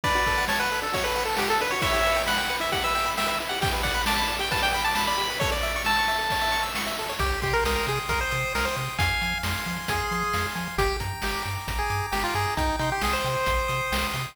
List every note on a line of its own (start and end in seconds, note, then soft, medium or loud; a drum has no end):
0.04 0.15 D4 loud
0.04 0.45 B4 medium
0.04 0.45 D5 medium
0.04 kick loud
0.04 crash loud
0.15 0.25 F#4 medium
0.26 0.37 A4 medium
0.26 kick medium
0.26 ride medium
0.37 0.47 F#5 medium
0.48 0.59 C#5 medium
0.48 0.59 A5 loud
0.48 snare loud
0.59 0.80 B4 medium
0.59 0.69 F#5 medium
0.71 0.82 A4 medium
0.71 ride medium
0.82 0.92 D4 medium
0.82 0.94 A4 medium
0.93 1.03 F#4 loud
0.93 1.05 C#5 medium
0.93 kick medium
0.93 ride loud
1.04 1.15 A4 medium
1.04 1.24 B4 medium
1.16 1.26 F#5 medium
1.16 ride medium
1.25 1.36 A4 medium
1.25 1.38 A5 medium
1.37 1.49 G4 medium
1.37 1.48 F#5 medium
1.37 snare loud
1.48 1.58 A4 medium
1.48 1.61 A4 medium
1.60 1.71 D4 medium
1.60 1.72 B4 medium
1.60 ride medium
1.71 1.82 F#4 loud
1.71 1.81 C#5 medium
1.82 1.92 E4 loud
1.82 2.22 C#5 medium
1.82 2.22 E5 medium
1.82 kick loud
1.82 ride loud
1.93 2.03 G4 medium
2.06 2.17 B4 medium
2.06 ride medium
2.16 2.26 G5 medium
2.26 2.37 F#5 medium
2.26 2.36 B5 loud
2.26 snare loud
2.37 2.56 F#5 medium
2.37 2.48 G5 medium
2.50 2.60 B4 medium
2.50 ride medium
2.60 2.70 E4 medium
2.60 2.71 E5 medium
2.72 2.82 G4 loud
2.72 2.83 F#5 medium
2.72 kick medium
2.72 ride loud
2.84 2.94 B4 medium
2.84 3.11 E5 medium
2.95 3.05 G5 loud
2.95 ride medium
3.06 3.16 B5 medium
3.17 3.27 E5 medium
3.17 3.27 G5 medium
3.17 snare loud
3.26 3.36 B4 medium
3.26 3.38 E5 medium
3.39 3.50 E4 medium
3.39 ride medium
3.49 3.61 G4 medium
3.49 3.60 F#5 medium
3.61 3.71 G4 loud
3.61 3.73 G5 medium
3.61 kick loud
3.61 ride loud
3.73 3.83 B4 medium
3.83 3.93 D5 loud
3.83 4.02 F#5 medium
3.83 kick medium
3.83 ride medium
3.94 4.05 B5 loud
4.06 4.16 A5 medium
4.06 4.17 D6 loud
4.06 snare loud
4.16 4.35 A5 medium
4.16 4.28 B5 medium
4.28 4.38 D5 medium
4.28 ride medium
4.39 4.49 G4 loud
4.39 4.51 G5 medium
4.51 4.61 B4 loud
4.51 4.62 A5 medium
4.51 kick loud
4.51 ride loud
4.62 4.72 D5 medium
4.62 4.72 G5 medium
4.72 4.83 G5 medium
4.72 4.84 B5 medium
4.72 ride medium
4.84 4.95 A5 medium
4.84 4.96 D6 medium
4.95 5.06 A5 medium
4.95 5.06 B5 loud
4.95 snare loud
5.07 5.17 D5 medium
5.07 5.39 B5 medium
5.18 5.28 G4 medium
5.18 ride medium
5.30 5.40 B4 medium
5.40 5.51 A4 loud
5.40 5.50 C#5 loud
5.40 kick loud
5.40 ride medium
5.51 5.62 C#5 medium
5.51 5.82 D5 medium
5.62 5.73 E5 loud
5.62 ride medium
5.76 5.86 C#6 medium
5.85 6.64 A5 medium
5.85 5.96 E6 loud
5.85 snare medium
5.99 6.09 C#6 medium
6.07 6.18 E5 medium
6.07 ride medium
6.19 6.29 A4 medium
6.30 6.42 C#5 medium
6.30 kick medium
6.30 ride loud
6.41 6.51 E5 medium
6.52 6.62 C#6 medium
6.52 ride medium
6.63 6.73 E6 medium
6.75 6.86 C#6 medium
6.75 snare loud
6.87 6.97 E5 loud
6.97 7.09 A4 medium
6.97 ride medium
7.09 7.19 C#5 loud
7.19 7.32 C2 loud
7.19 7.40 G4 medium
7.19 7.88 G5 medium
7.19 kick medium
7.19 closed hi-hat loud
7.42 7.54 C3 medium
7.42 7.54 G4 medium
7.42 8.09 C6 medium
7.42 kick medium
7.42 closed hi-hat medium
7.53 7.64 A#4 medium
7.64 7.77 C2 loud
7.64 7.75 A#4 medium
7.64 8.31 D#6 medium
7.64 snare loud
7.76 7.86 A#4 medium
7.87 7.99 C3 loud
7.87 7.99 G#4 medium
7.87 8.54 G5 medium
7.87 closed hi-hat medium
8.09 8.21 C2 medium
8.09 8.20 A#4 medium
8.09 8.76 C6 medium
8.09 kick medium
8.09 closed hi-hat loud
8.21 8.53 C5 medium
8.31 8.45 C3 loud
8.31 8.95 D#6 medium
8.31 closed hi-hat medium
8.54 8.67 C2 medium
8.54 8.66 A#4 medium
8.54 8.97 G5 medium
8.54 snare loud
8.65 8.76 C5 medium
8.76 8.89 C3 loud
8.76 8.97 C6 medium
8.76 closed hi-hat medium
8.99 9.11 F2 loud
8.99 9.38 F5 medium
8.99 9.65 F5 medium
8.99 9.38 G#5 medium
8.99 kick loud
8.99 closed hi-hat loud
9.21 9.34 F3 medium
9.21 9.89 G#5 medium
9.21 closed hi-hat medium
9.43 9.56 F2 loud
9.43 10.11 C6 medium
9.43 snare loud
9.66 9.79 F3 loud
9.66 10.34 F5 medium
9.66 closed hi-hat medium
9.88 10.01 F2 medium
9.88 10.47 G#4 medium
9.88 10.55 G#5 medium
9.88 kick medium
9.88 closed hi-hat loud
10.11 10.24 F3 loud
10.11 10.75 C6 medium
10.11 closed hi-hat medium
10.34 10.46 F2 medium
10.34 10.77 F5 medium
10.34 snare medium
10.55 10.68 F3 loud
10.55 10.77 G#5 medium
10.55 closed hi-hat medium
10.78 10.90 G1 loud
10.78 10.97 G4 medium
10.78 11.44 G5 medium
10.78 kick loud
10.78 closed hi-hat loud
11.00 11.13 G2 medium
11.00 11.67 A#5 medium
11.00 kick medium
11.00 closed hi-hat medium
11.22 11.35 G1 medium
11.22 11.43 G4 medium
11.22 11.90 D6 medium
11.22 snare loud
11.45 11.58 G2 medium
11.45 12.11 G5 medium
11.45 closed hi-hat medium
11.68 11.80 A1 medium
11.68 12.35 A#5 medium
11.68 kick medium
11.68 closed hi-hat loud
11.79 12.06 G#4 medium
11.90 12.02 G2 loud
11.90 12.54 D6 medium
11.90 closed hi-hat medium
12.12 12.25 G1 medium
12.12 12.23 G4 medium
12.12 12.54 G5 medium
12.12 snare loud
12.24 12.34 F4 medium
12.34 12.47 G2 loud
12.34 12.55 G#4 medium
12.34 12.57 A#5 medium
12.34 closed hi-hat medium
12.57 12.70 C2 loud
12.57 12.76 D#4 medium
12.57 13.25 G5 loud
12.57 kick medium
12.57 closed hi-hat medium
12.79 12.92 C3 loud
12.79 12.90 D#4 medium
12.79 13.48 C6 medium
12.79 closed hi-hat medium
12.92 13.03 G4 medium
13.01 13.15 C2 medium
13.01 13.14 G#4 medium
13.01 13.68 D#6 medium
13.01 snare loud
13.13 14.07 C5 medium
13.24 13.37 C3 loud
13.24 13.92 G5 medium
13.24 closed hi-hat medium
13.46 13.60 A#1 loud
13.46 14.14 C6 medium
13.46 kick medium
13.46 closed hi-hat loud
13.68 13.81 C3 medium
13.68 14.32 D#6 medium
13.68 closed hi-hat medium
13.92 14.04 C2 loud
13.92 14.35 G5 medium
13.92 snare loud
14.13 14.26 C3 loud
14.13 14.36 C6 medium
14.13 closed hi-hat medium